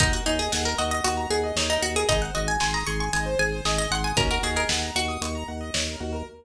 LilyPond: <<
  \new Staff \with { instrumentName = "Pizzicato Strings" } { \time 4/4 \key ees \dorian \tempo 4 = 115 ees'16 ges'16 ees'16 aes'16 aes'16 bes'16 ees''16 ees''16 ges'8 aes'8. ees'16 ges'16 aes'16 | ees''16 ges''16 ees''16 aes''16 aes''16 bes''16 des'''16 des'''16 aes''8 aes''8. ees''16 ges''16 aes''16 | bes'16 bes'16 aes'16 bes'16 r8 ges'2~ ges'8 | }
  \new Staff \with { instrumentName = "Pizzicato Strings" } { \time 4/4 \key ees \dorian bes'8 aes'4 ges'4. ees'4 | ees'8 ges'4 aes'4. aes'4 | des'16 ges'16 ges'16 aes'8. r2 r8 | }
  \new Staff \with { instrumentName = "Acoustic Grand Piano" } { \time 4/4 \key ees \dorian ges'16 bes'16 des''16 ees''16 ges''16 bes''16 des'''16 ees'''16 des'''16 bes''16 ges''16 ees''16 des''16 bes'16 ges'16 bes'16 | aes'16 c''16 ees''16 aes''16 c'''16 ees'''16 c'''16 aes''16 ees''16 c''16 aes'16 c''16 ees''16 aes''16 c'''16 ees'''16 | ges'16 bes'16 des''16 ees''16 ges''16 bes''16 des'''16 ees'''16 des'''16 bes''16 ges''16 ees''16 des''16 bes'16 ges'16 bes'16 | }
  \new Staff \with { instrumentName = "Drawbar Organ" } { \clef bass \time 4/4 \key ees \dorian ees,8 ees,8 ees,8 ees,8 ees,8 ees,8 ees,8 ees,8 | aes,,8 aes,,8 aes,,8 aes,,8 aes,,8 aes,,8 aes,,8 aes,,8 | ees,8 ees,8 ees,8 ees,8 ees,8 ees,8 ees,8 ees,8 | }
  \new DrumStaff \with { instrumentName = "Drums" } \drummode { \time 4/4 <hh bd>4 sn4 hh4 sn4 | <hh bd>4 sn4 hh4 sn4 | <hh bd>4 sn4 hh4 sn4 | }
>>